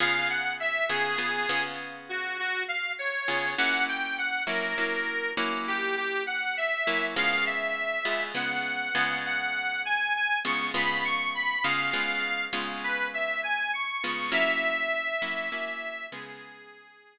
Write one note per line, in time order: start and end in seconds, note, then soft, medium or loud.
0.00 0.83 C#3 medium
0.00 0.83 B3 medium
0.00 0.83 F4 medium
0.00 0.83 G#4 medium
0.00 0.28 F5 medium
0.29 0.53 F#5 medium
0.60 0.86 E5 medium
0.89 1.17 C#3 medium
0.89 1.17 B3 medium
0.89 1.17 F4 medium
0.89 1.63 G#4 medium
0.89 1.17 G#4 medium
1.18 1.47 C#3 medium
1.18 1.47 B3 medium
1.18 1.47 F4 medium
1.18 1.47 G#4 medium
1.49 3.16 C#3 medium
1.49 3.16 B3 medium
1.49 3.16 F4 medium
1.49 3.16 G#4 medium
2.09 2.37 F#4 medium
2.39 2.63 F#4 medium
2.68 2.92 F5 medium
2.99 3.53 C#5 medium
3.28 3.55 C#3 medium
3.28 3.55 B3 medium
3.28 3.55 F4 medium
3.28 3.55 G#4 medium
3.58 4.41 F#3 medium
3.58 4.41 A#3 medium
3.58 4.41 C#4 medium
3.58 4.41 E4 medium
3.58 3.84 F#5 medium
3.88 4.17 G5 medium
4.18 4.43 F#5 medium
4.47 4.74 F#3 medium
4.47 4.74 A#3 medium
4.47 4.74 C#4 medium
4.47 4.74 E4 medium
4.47 5.31 A#4 medium
4.78 5.33 F#3 medium
4.78 5.33 A#3 medium
4.78 5.33 C#4 medium
4.78 5.33 E4 medium
5.37 6.75 F#3 medium
5.37 6.75 A#3 medium
5.37 6.75 C#4 medium
5.37 6.75 E4 medium
5.68 5.95 G4 medium
5.97 6.23 G4 medium
6.27 6.55 F#5 medium
6.57 7.05 E5 medium
6.87 7.15 F#3 medium
6.87 7.15 A#3 medium
6.87 7.15 C#4 medium
6.87 7.15 E4 medium
7.16 7.99 C#3 medium
7.16 7.99 G#3 medium
7.16 7.99 B3 medium
7.16 7.99 F4 medium
7.16 7.45 F5 loud
7.46 8.24 E5 medium
8.05 8.33 C#3 medium
8.05 8.33 G#3 medium
8.05 8.33 B3 medium
8.05 8.33 F4 medium
8.35 8.90 C#3 medium
8.35 8.90 G#3 medium
8.35 8.90 B3 medium
8.35 8.90 F4 medium
8.35 9.18 F#5 medium
8.95 10.32 C#3 medium
8.95 10.32 G#3 medium
8.95 10.32 B3 medium
8.95 10.32 F4 medium
9.25 9.82 F#5 medium
9.85 10.13 G#5 medium
10.15 10.39 G#5 medium
10.45 10.72 C#3 medium
10.45 10.72 G#3 medium
10.45 10.72 B3 medium
10.45 10.72 F4 medium
10.45 10.70 C#6 medium
10.74 11.57 C#3 medium
10.74 11.57 G#3 medium
10.74 11.57 B3 medium
10.74 11.57 F4 medium
10.74 11.03 B5 medium
11.05 11.33 C#6 medium
11.35 11.64 B5 medium
11.64 11.92 C#3 medium
11.64 11.92 G#3 medium
11.64 11.92 B3 medium
11.64 11.92 F4 medium
11.64 12.45 F5 medium
11.93 12.48 C#3 medium
11.93 12.48 G#3 medium
11.93 12.48 B3 medium
11.93 12.48 F4 medium
12.53 13.90 C#3 medium
12.53 13.90 G#3 medium
12.53 13.90 B3 medium
12.53 13.90 F4 medium
12.83 13.08 B4 medium
13.14 13.41 E5 medium
13.43 13.71 G#5 medium
13.73 14.30 C#6 medium
14.04 14.31 C#3 medium
14.04 14.31 G#3 medium
14.04 14.31 B3 medium
14.04 14.31 F4 medium
14.32 15.14 F#3 medium
14.32 15.14 A#3 loud
14.32 15.14 C#4 medium
14.32 15.14 E4 medium
14.32 16.06 E5 loud
15.22 15.49 F#3 medium
15.22 15.49 A#3 medium
15.22 15.49 C#4 medium
15.22 15.49 E4 medium
15.52 16.07 F#3 medium
15.52 16.07 A#3 medium
15.52 16.07 C#4 medium
15.52 16.07 E4 medium
16.12 17.18 C#3 medium
16.12 17.18 G#3 medium
16.12 17.18 B3 medium
16.12 17.18 F4 medium
16.12 17.18 G#4 medium